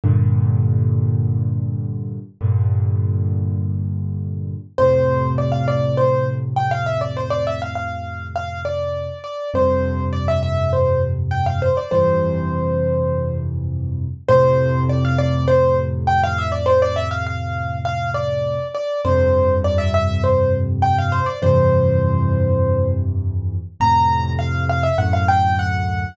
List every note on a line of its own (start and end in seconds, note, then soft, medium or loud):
0.04 2.18 G2 medium
0.04 2.18 A#2 medium
0.04 2.18 D3 medium
2.41 4.55 G2 medium
2.41 4.55 A#2 medium
2.41 4.55 D3 medium
4.78 9.07 F2 medium
4.78 9.07 A2 medium
4.78 9.07 C3 medium
4.78 5.29 C5 medium
5.38 5.52 D5 medium
5.52 5.66 F5 medium
5.68 5.96 D5 medium
5.97 6.26 C5 medium
6.56 6.70 G5 medium
6.71 6.85 F5 medium
6.86 7.00 E5 medium
7.01 7.15 D5 medium
7.17 7.31 C5 medium
7.30 7.44 D5 medium
7.47 7.61 E5 medium
7.62 7.75 F5 medium
7.75 8.27 F5 medium
8.36 8.61 F5 medium
8.65 9.18 D5 medium
9.24 9.50 D5 medium
9.54 11.68 F2 medium
9.54 11.68 G2 medium
9.54 11.68 C3 medium
9.54 10.04 C5 medium
10.13 10.27 D5 medium
10.28 10.42 E5 medium
10.43 10.70 E5 medium
10.73 11.01 C5 medium
11.31 11.45 G5 medium
11.46 11.60 F5 medium
11.62 11.76 C5 medium
11.77 11.91 D5 medium
11.91 14.06 F2 medium
11.91 14.06 G2 medium
11.91 14.06 C3 medium
11.91 14.06 E3 medium
11.91 13.36 C5 medium
14.28 18.57 F2 medium
14.28 18.57 A2 medium
14.28 18.57 C3 medium
14.28 14.80 C5 loud
14.89 15.03 D5 medium
15.05 15.19 F5 medium
15.18 15.46 D5 medium
15.48 15.77 C5 medium
16.07 16.21 G5 medium
16.24 16.38 F5 medium
16.38 16.52 E5 medium
16.52 16.66 D5 medium
16.66 16.80 C5 medium
16.82 16.96 D5 medium
16.96 17.10 E5 medium
17.11 17.25 F5 medium
17.26 17.78 F5 medium
17.85 18.10 F5 medium
18.14 18.68 D5 medium
18.75 19.01 D5 medium
19.05 21.19 F2 medium
19.05 21.19 G2 medium
19.05 21.19 C3 medium
19.05 19.54 C5 medium
19.64 19.78 D5 medium
19.78 19.92 E5 medium
19.94 20.22 E5 medium
20.24 20.52 C5 medium
20.82 20.96 G5 medium
20.98 21.12 F5 medium
21.12 21.26 C5 medium
21.26 21.40 D5 medium
21.42 23.56 F2 medium
21.42 23.56 G2 medium
21.42 23.56 C3 medium
21.42 23.56 E3 medium
21.42 22.87 C5 medium
23.80 24.87 F2 medium
23.80 24.87 A2 medium
23.80 24.87 C3 medium
23.80 24.29 A#5 medium
24.39 24.64 F5 medium
24.69 24.83 F5 medium
24.83 24.97 E5 medium
24.98 26.05 D2 medium
24.98 26.05 F#2 medium
24.98 26.05 A2 medium
24.98 25.12 F#5 medium
25.13 25.27 F5 medium
25.28 25.55 G5 medium
25.59 26.15 F#5 medium